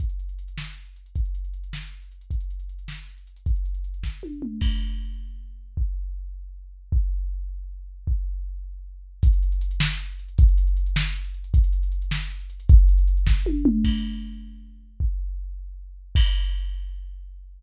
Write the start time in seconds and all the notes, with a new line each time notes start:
0.00 kick, closed hi-hat
0.10 closed hi-hat
0.20 closed hi-hat
0.29 closed hi-hat
0.39 closed hi-hat
0.48 closed hi-hat
0.58 snare
0.67 closed hi-hat
0.77 closed hi-hat
0.86 closed hi-hat
0.96 closed hi-hat
1.06 closed hi-hat
1.15 kick, closed hi-hat
1.25 closed hi-hat
1.35 closed hi-hat
1.44 closed hi-hat
1.54 closed hi-hat
1.64 closed hi-hat
1.73 snare
1.83 closed hi-hat
1.92 closed hi-hat
2.02 closed hi-hat
2.12 closed hi-hat
2.21 closed hi-hat
2.31 kick, closed hi-hat
2.41 closed hi-hat
2.50 closed hi-hat
2.59 closed hi-hat
2.69 closed hi-hat
2.79 closed hi-hat
2.88 snare
2.99 closed hi-hat
3.08 closed hi-hat
3.18 closed hi-hat
3.27 closed hi-hat
3.36 closed hi-hat
3.46 kick, closed hi-hat
3.56 closed hi-hat
3.65 closed hi-hat
3.75 closed hi-hat
3.84 closed hi-hat
3.94 closed hi-hat
4.03 kick, snare
4.23 high tom
4.42 mid tom
4.61 kick, crash
5.77 kick
6.92 kick
8.07 kick
9.23 kick, closed hi-hat
9.33 closed hi-hat
9.43 closed hi-hat
9.52 closed hi-hat
9.61 closed hi-hat
9.71 closed hi-hat
9.80 snare
9.91 closed hi-hat
10.00 closed hi-hat
10.10 closed hi-hat
10.19 closed hi-hat
10.28 closed hi-hat
10.38 kick, closed hi-hat
10.48 closed hi-hat
10.58 closed hi-hat
10.67 closed hi-hat
10.77 closed hi-hat
10.87 closed hi-hat
10.96 snare
11.06 closed hi-hat
11.15 closed hi-hat
11.25 closed hi-hat
11.34 closed hi-hat
11.44 closed hi-hat
11.54 kick, closed hi-hat
11.64 closed hi-hat
11.73 closed hi-hat
11.83 closed hi-hat
11.92 closed hi-hat
12.02 closed hi-hat
12.11 snare
12.21 closed hi-hat
12.31 closed hi-hat
12.40 closed hi-hat
12.50 closed hi-hat
12.60 closed hi-hat
12.69 kick, closed hi-hat
12.79 closed hi-hat
12.88 closed hi-hat
12.98 closed hi-hat
13.08 closed hi-hat
13.17 closed hi-hat
13.27 kick, snare
13.46 high tom
13.65 mid tom
13.84 kick, crash
15.00 kick
16.15 kick, crash